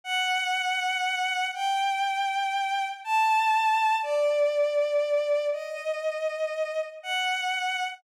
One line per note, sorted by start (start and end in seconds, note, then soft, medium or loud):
0.04 1.45 F#5 loud
1.54 2.85 G5 medium
3.04 3.96 A5 medium
4.03 5.46 D5 loud
5.53 6.79 D#5 medium
7.03 7.84 F#5 medium